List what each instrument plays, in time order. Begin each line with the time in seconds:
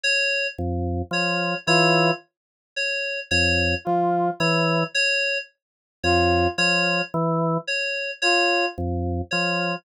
0.04 electric piano 2 C#5
0.58 drawbar organ F2
1.11 drawbar organ F3, electric piano 2 C#5
1.67 drawbar organ E3, brass section F4, electric piano 2 C#5
2.76 electric piano 2 C#5
3.31 drawbar organ F2, electric piano 2 C#5
3.85 drawbar organ F3, brass section F4
4.40 drawbar organ E3, electric piano 2 C#5
4.95 electric piano 2 C#5
6.04 drawbar organ F2, brass section F4, electric piano 2 C#5
6.58 drawbar organ F3, electric piano 2 C#5
7.14 drawbar organ E3
7.67 electric piano 2 C#5
8.22 brass section F4, electric piano 2 C#5
8.78 drawbar organ F2
9.31 drawbar organ F3, electric piano 2 C#5